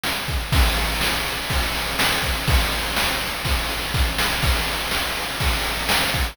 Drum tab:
CC |--|--------|--------|x-------|
RD |-x|xx-xxx-x|xx-xxx--|-x-xxx-x|
SD |o-|--o---o-|--o---oo|--o---o-|
BD |-o|o---o--o|o---o-o-|o---o--o|